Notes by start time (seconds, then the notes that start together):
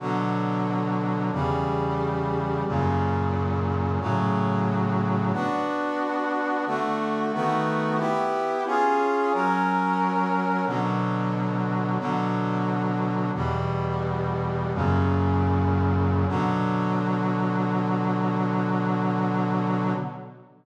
0.00 B2 D3 F#3
1.33 E2 C#3 G3
2.67 F#2 A#2 C#3
4.00 A2 C#3 F#3
5.33 B3 D4 F#4
6.66 D3 A3 F#4
7.33 D#3 A3 B3 F#4
7.98 B3 E4 G4
8.67 C#4 F4 G#4
9.33 F#3 C#4 A#4
10.66 B2 D3 F#3
11.99 B2 D3 F#3
13.35 E2 B2 G3
14.74 F#2 A#2 C#3
16.28 B2 D3 F#3